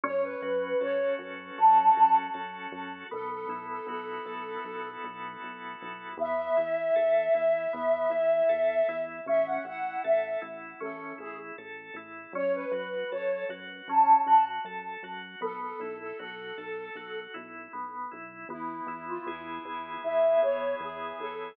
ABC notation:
X:1
M:4/4
L:1/16
Q:1/4=78
K:E
V:1 name="Flute"
c B B2 c2 z2 a2 a z5 | A A2 A A6 z6 | e16 | e f f2 e2 z2 A2 G z5 |
c B B2 c2 z2 a2 a z5 | A A2 A A6 z6 | E3 =F E2 E2 e2 c2 G2 A2 |]
V:2 name="Drawbar Organ"
C2 F2 A2 F2 C2 F2 A2 F2 | B,2 E2 F2 A2 F2 E2 B,2 E2 | B,2 E2 A2 E2 B,2 E2 A2 E2 | C2 E2 A2 E2 C2 E2 A2 E2 |
C2 F2 A2 F2 C2 F2 A2 F2 | B,2 E2 F2 A2 F2 E2 B,2 E2 | B,2 E2 G2 E2 B,2 E2 G2 E2 |]
V:3 name="Synth Bass 1" clef=bass
F,,2 F,,2 F,,2 F,,2 F,,2 F,,2 F,,2 F,,2 | B,,,2 B,,,2 B,,,2 B,,,2 B,,,2 B,,,2 B,,,2 B,,,2 | E,,2 E,,2 E,,2 E,,2 E,,2 E,,2 E,,2 E,,2 | A,,,2 A,,,2 A,,,2 A,,,2 A,,,2 A,,,2 A,,,2 A,,,2 |
F,,2 F,,2 F,,2 F,,2 F,,2 F,,2 F,,2 F,,2 | B,,,2 B,,,2 B,,,2 B,,,2 B,,,2 B,,,2 B,,,2 B,,,2 | E,,2 E,,2 E,,2 E,,2 E,,2 E,,2 E,,2 E,,2 |]